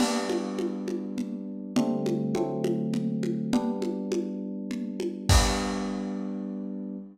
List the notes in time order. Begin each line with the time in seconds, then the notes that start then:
0.00 G3 B3 D4, crash, low conga
0.30 high conga
0.59 high conga
0.88 high conga
1.18 low conga
1.76 D3 G3 A3 C4, low conga
2.06 high conga
2.35 D3 F#3 A3 C4, high conga
2.64 high conga
2.94 low conga
3.23 high conga
3.53 G3 B3 D4, low conga
3.82 high conga
4.12 high conga
4.71 low conga
5.00 high conga
5.29 G3 B3 D4, kick, crash